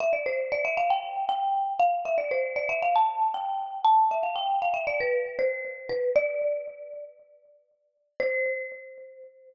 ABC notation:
X:1
M:4/4
L:1/16
Q:1/4=117
K:C
V:1 name="Marimba"
e d c2 d e f g3 g4 f2 | e d c2 d e f a3 g4 a2 | e f g2 f e d B3 c4 B2 | d8 z8 |
c16 |]